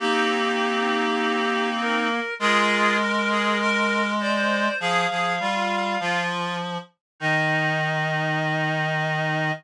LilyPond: <<
  \new Staff \with { instrumentName = "Clarinet" } { \time 2/2 \key ees \major \tempo 2 = 50 g'2. bes'4 | bes'2. d''4 | f''2~ f''8 r4. | ees''1 | }
  \new Staff \with { instrumentName = "Clarinet" } { \time 2/2 \key ees \major <c' ees'>1 | <f' aes'>4 bes'8 aes'8 bes'4 c''4 | aes'8 aes'8 f'4 f'4 r4 | ees'1 | }
  \new Staff \with { instrumentName = "Clarinet" } { \time 2/2 \key ees \major bes1 | aes1 | f8 f8 g4 f4. r8 | ees1 | }
>>